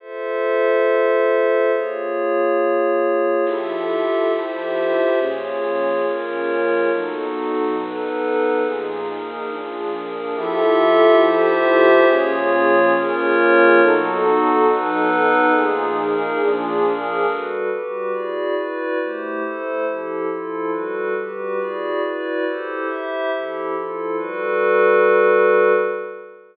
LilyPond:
<<
  \new Staff \with { instrumentName = "Pad 2 (warm)" } { \time 4/4 \key f \mixolydian \tempo 4 = 139 r1 | r1 | <f e' g' a'>1 | <bes, f des' aes'>1 |
<b, fis dis' a'>1 | <bes, f ees' aes'>2 <bes, f d' aes'>2 | <f e' g' a'>1 | <bes, f des' aes'>1 |
<b, fis dis' a'>1 | <bes, f ees' aes'>2 <bes, f d' aes'>2 | \key g \mixolydian r1 | r1 |
r1 | r1 | r1 | }
  \new Staff \with { instrumentName = "Pad 5 (bowed)" } { \time 4/4 \key f \mixolydian <f' a' c'' e''>1 | <bes f' aes' des''>1 | <f' g' a' e''>2 <f' g' c'' e''>2 | <bes f' aes' des''>2 <bes f' bes' des''>2 |
<b dis' fis' a'>2 <b dis' a' b'>2 | <bes ees' f' aes'>4 <bes ees' aes' bes'>4 <bes d' f' aes'>4 <bes d' aes' bes'>4 | <f' g' a' e''>2 <f' g' c'' e''>2 | <bes f' aes' des''>2 <bes f' bes' des''>2 |
<b dis' fis' a'>2 <b dis' a' b'>2 | <bes ees' f' aes'>4 <bes ees' aes' bes'>4 <bes d' f' aes'>4 <bes d' aes' bes'>4 | \key g \mixolydian <g fis' a' b'>4 <g fis' g' b'>4 <e' fis' gis' d''>4 <e' fis' b' d''>4 | <a e' g' c''>4 <a e' a' c''>4 <f e' g' a'>4 <f e' f' a'>4 |
<g fis' a' b'>4 <g fis' g' b'>4 <e' fis' gis' d''>4 <e' fis' b' d''>4 | <e' g' a' c''>4 <e' g' c'' e''>4 <f e' g' a'>4 <f e' f' a'>4 | <g fis' a' b'>1 | }
>>